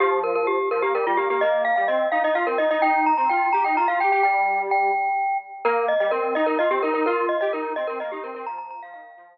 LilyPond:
<<
  \new Staff \with { instrumentName = "Glockenspiel" } { \time 6/8 \key ees \major \tempo 4. = 85 g'8 bes'16 bes'16 g'8 bes'16 g'16 bes'16 f'16 g'16 g'16 | ees''8 f''16 f''16 ees''8 f''16 ees''16 f''16 bes'16 ees''16 ees''16 | g''8 bes''16 bes''16 g''8 bes''16 g''16 bes''16 f''16 g''16 g''16 | g''4 g''4. r8 |
bes'8 ees''16 ees''16 bes'8 ees''16 bes'16 ees''16 g'16 bes'16 bes'16 | bes'8 ees''16 ees''16 bes'8 ees''16 bes'16 ees''16 g'16 bes'16 bes'16 | bes''16 bes''16 bes''16 f''16 f''4 r4 | }
  \new Staff \with { instrumentName = "Lead 1 (square)" } { \time 6/8 \key ees \major f4. f16 bes16 g16 g16 bes16 bes16 | bes8. g16 c'8 ees'16 ees'16 f'16 c'16 ees'16 ees'16 | ees'8. c'16 f'8 g'16 ees'16 f'16 f'16 g'16 g'16 | g4. r4. |
bes8. g16 c'8 ees'16 ees'16 f'16 c'16 ees'16 ees'16 | f'8. g'16 ees'8 c'16 c'16 bes16 ees'16 c'16 c'16 | f8. f16 ees8 f8 r4 | }
>>